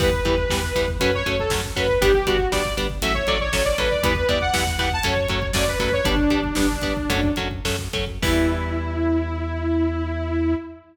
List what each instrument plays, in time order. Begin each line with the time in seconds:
0.00 synth bass 1 E2, overdriven guitar E3 G3 B3, lead 2 (sawtooth) B4, kick, crash
0.13 kick
0.25 synth bass 1 E2, overdriven guitar E3 G3 B3, kick, closed hi-hat
0.38 kick
0.50 synth bass 1 E2, overdriven guitar E3 G3 B3, kick, snare
0.63 kick
0.75 synth bass 1 E2, overdriven guitar E3 G3 B3, kick, closed hi-hat
0.88 kick
1.00 synth bass 1 F#2, overdriven guitar F#3 A3 C#4, lead 2 (sawtooth) B4, kick, closed hi-hat
1.13 lead 2 (sawtooth) C#5, kick
1.26 synth bass 1 F#2, overdriven guitar F#3 A3 C#4, kick, closed hi-hat
1.39 lead 2 (sawtooth) A4, kick
1.50 synth bass 1 F#2, overdriven guitar F#3 A3 C#4, kick, snare
1.65 kick
1.75 synth bass 1 F#2, overdriven guitar F#3 A3 C#4, lead 2 (sawtooth) B4, kick, closed hi-hat
1.88 kick
2.01 synth bass 1 G1, overdriven guitar G3 B3 D4, lead 2 (sawtooth) G4, kick, closed hi-hat
2.13 lead 2 (sawtooth) G4, kick
2.27 synth bass 1 G1, overdriven guitar G3 B3 D4, lead 2 (sawtooth) F#4, kick, closed hi-hat
2.39 kick
2.52 synth bass 1 G1, overdriven guitar G3 B3 D4, lead 2 (sawtooth) D5, kick, snare
2.66 kick
2.77 synth bass 1 G1, overdriven guitar G3 B3 D4, kick, closed hi-hat
2.90 kick
3.02 synth bass 1 A1, overdriven guitar F#3 A3 C#4, lead 2 (sawtooth) E5, kick, closed hi-hat
3.14 lead 2 (sawtooth) C#5, kick
3.27 synth bass 1 A1, overdriven guitar F#3 A3 C#4, lead 2 (sawtooth) D5, kick, closed hi-hat
3.40 lead 2 (sawtooth) C#5, kick
3.53 synth bass 1 A1, overdriven guitar F#3 A3 C#4, kick, snare
3.64 lead 2 (sawtooth) D5, kick
3.78 synth bass 1 A1, overdriven guitar F#3 A3 C#4, lead 2 (sawtooth) B4, kick, closed hi-hat
3.91 lead 2 (sawtooth) D5, kick
4.03 synth bass 1 E2, overdriven guitar E3 G3 B3, lead 2 (sawtooth) B4, kick, closed hi-hat
4.15 kick
4.29 synth bass 1 E2, overdriven guitar E3 G3 B3, lead 2 (sawtooth) D5, kick, closed hi-hat
4.41 lead 2 (sawtooth) F#5, kick
4.54 synth bass 1 E2, overdriven guitar E3 G3 B3, kick, snare
4.67 kick
4.78 synth bass 1 E2, overdriven guitar E3 G3 B3, lead 2 (sawtooth) F#5, kick, closed hi-hat
4.90 lead 2 (sawtooth) A5, kick
5.03 synth bass 1 F#2, overdriven guitar F#3 A3 C#4, lead 2 (sawtooth) C#5, kick, closed hi-hat
5.17 kick
5.28 synth bass 1 F#2, overdriven guitar F#3 A3 C#4, kick, closed hi-hat
5.42 kick
5.53 synth bass 1 F#2, overdriven guitar F#3 A3 C#4, lead 2 (sawtooth) D5, kick, snare
5.68 lead 2 (sawtooth) B4, kick
5.79 synth bass 1 F#2, overdriven guitar F#3 A3 C#4, lead 2 (sawtooth) B4, kick, closed hi-hat
5.92 lead 2 (sawtooth) C#5, kick
6.05 synth bass 1 G1, overdriven guitar G3 B3 D4, lead 2 (sawtooth) D4, kick, closed hi-hat
6.17 kick
6.30 synth bass 1 G1, overdriven guitar G3 B3 D4, kick, closed hi-hat
6.44 kick
6.55 synth bass 1 G1, overdriven guitar G3 B3 D4, lead 2 (sawtooth) D4, kick, snare
6.70 kick
6.81 synth bass 1 G1, overdriven guitar G3 B3 D4, kick, closed hi-hat
6.97 kick
7.09 synth bass 1 F#2, overdriven guitar F#3 A3 C#4, kick, closed hi-hat
7.23 kick
7.36 synth bass 1 F#2, overdriven guitar F#3 A3 C#4, kick, closed hi-hat
7.51 kick
7.64 synth bass 1 F#2, overdriven guitar F#3 A3 C#4, kick, snare
7.79 kick
7.93 synth bass 1 F#2, overdriven guitar F#3 A3 C#4, kick, closed hi-hat
8.07 kick
8.22 synth bass 1 E2, overdriven guitar E3 G3 B3, lead 2 (sawtooth) E4, kick, crash